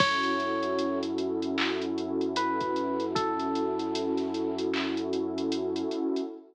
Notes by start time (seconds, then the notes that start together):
0.00 F#2 C#4 E4 F#4 A4 C#5, kick, crash
0.23 closed hi-hat
0.40 closed hi-hat
0.63 closed hi-hat
0.79 closed hi-hat
1.03 closed hi-hat
1.18 closed hi-hat
1.42 closed hi-hat
1.58 clap
1.82 closed hi-hat
1.98 closed hi-hat
2.21 closed hi-hat
2.36 B4, closed hi-hat
2.61 kick, closed hi-hat
2.76 closed hi-hat
3.00 closed hi-hat
3.15 A4, kick, closed hi-hat
3.39 closed hi-hat
3.55 closed hi-hat
3.79 closed hi-hat
3.95 closed hi-hat
4.17 snare, closed hi-hat
4.34 closed hi-hat
4.58 closed hi-hat
4.74 clap
4.97 closed hi-hat
5.13 closed hi-hat
5.38 closed hi-hat
5.52 closed hi-hat
5.76 closed hi-hat
5.91 closed hi-hat
6.16 closed hi-hat